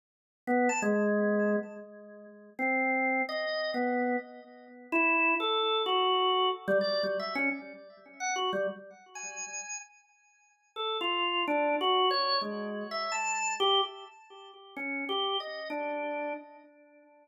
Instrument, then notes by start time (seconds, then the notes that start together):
drawbar organ
0.47 B3
0.69 A5
0.82 G#3
2.59 C4
3.29 D#5
3.74 B3
4.92 E4
5.40 A4
5.86 F#4
6.68 G3
6.81 D5
7.03 G3
7.20 E5
7.35 C#4
8.20 F#5
8.36 F#4
8.53 G3
9.15 G#5
10.76 A4
11.01 F4
11.48 D4
11.81 F#4
12.11 C#5
12.42 G#3
12.91 E5
13.12 A5
13.60 G4
14.76 C#4
15.09 G4
15.40 D#5
15.70 D4